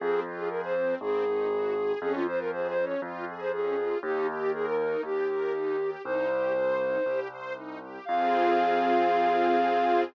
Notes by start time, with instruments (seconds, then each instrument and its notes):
0.00 acoustic grand piano F2, string ensemble 1 C4, flute G#4
0.25 string ensemble 1 F4
0.37 flute G#4
0.49 string ensemble 1 G#4, flute A#4
0.64 flute C5
0.76 string ensemble 1 C4
1.01 acoustic grand piano G#1, string ensemble 1 C4, flute G#4
1.25 string ensemble 1 D#4
1.51 string ensemble 1 F#4
1.76 string ensemble 1 G#4
2.00 acoustic grand piano F2, string ensemble 1 C#4, flute G#4
2.15 flute F4
2.27 string ensemble 1 F4, flute C5
2.39 flute A#4
2.52 string ensemble 1 G#4, flute C5
2.69 flute C5
2.77 string ensemble 1 C#4
2.85 flute C#5
3.02 acoustic grand piano F2, string ensemble 1 F4
3.27 string ensemble 1 G#4
3.40 flute C5
3.52 string ensemble 1 C#4, flute G#4
3.77 string ensemble 1 F4
4.03 acoustic grand piano D#2, string ensemble 1 D#4, flute G4
4.28 string ensemble 1 G4
4.40 flute G4
4.52 flute G#4, string ensemble 1 A#4
4.65 flute A#4
4.80 string ensemble 1 D#4
5.03 acoustic grand piano D#2, flute G4, string ensemble 1 G4
5.29 string ensemble 1 A#4
5.54 string ensemble 1 D#4
5.79 string ensemble 1 G4
6.04 acoustic grand piano C2, string ensemble 1 D#4, flute C5
6.30 string ensemble 1 G4
6.56 string ensemble 1 C5
6.79 string ensemble 1 D#4
7.05 acoustic grand piano C2, string ensemble 1 G4
7.31 string ensemble 1 C5
7.55 string ensemble 1 D#4
7.81 string ensemble 1 G4
8.05 acoustic grand piano F2, string ensemble 1 C4 F4 G#4, flute F5